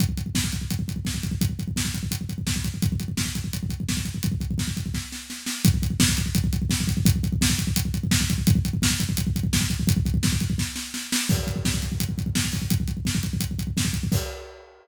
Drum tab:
CC |----------------|----------------|----------------|----------------|
HH |x-x---x-x-x---x-|x-x---x-x-x---x-|x-x---x-x-x---x-|x-x---x---------|
SD |----o-------o---|----o-------o---|----o-------o---|----o---o-o-o-o-|
BD |oooooooooooooooo|oooooooooooooooo|oooooooooooooooo|ooooooooo-------|

CC |----------------|----------------|----------------|----------------|
HH |x-x---x-x-x---x-|x-x---x-x-x---x-|x-x---x-x-x---x-|x-x---x---------|
SD |----o-------o---|----o-------o---|----o-------o---|----o---o-o-o-o-|
BD |oooooooooooooooo|oooooooooooooooo|oooooooooooooooo|ooooooooo-------|

CC |x---------------|----------------|x---------------|
HH |--x---x-x-x---o-|x-x---x-x-x---x-|----------------|
SD |----o-------o---|----o-------o---|----------------|
BD |oooooooooooooooo|oooooooooooooooo|o---------------|